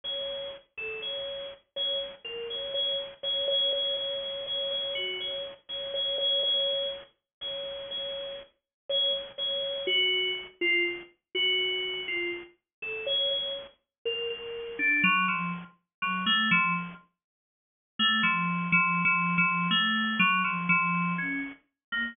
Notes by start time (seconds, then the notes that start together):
0.04 C#5
0.77 A4
1.02 C#5
1.76 C#5
2.24 A#4
2.50 C#5
2.74 C#5
3.23 C#5
3.48 C#5
3.73 C#5
3.97 C#5
4.22 C#5
4.46 C#5
4.71 C#5
4.95 F#4
5.20 C#5
5.69 C#5
5.94 C#5
6.18 C#5
6.43 C#5
7.41 C#5
7.91 C#5
8.89 C#5
9.38 C#5
9.87 F#4
10.61 F4
11.35 F#4
12.08 F4
12.82 A4
13.06 C#5
13.31 C#5
14.05 A#4
14.30 A#4
14.79 D4
15.03 F#3
15.28 F3
16.02 F#3
16.26 A3
16.51 F3
17.99 A3
18.23 F3
18.72 F3
19.05 F3
19.38 F3
19.71 A3
20.19 F#3
20.44 F3
20.69 F3
21.18 C#4
21.92 A#3